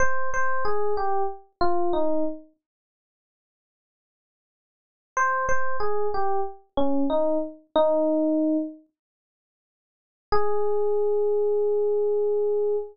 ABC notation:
X:1
M:4/4
L:1/8
Q:1/4=93
K:Ab
V:1 name="Electric Piano 1"
c c A G z F E z | z8 | c c A G z D E z | E3 z5 |
A8 |]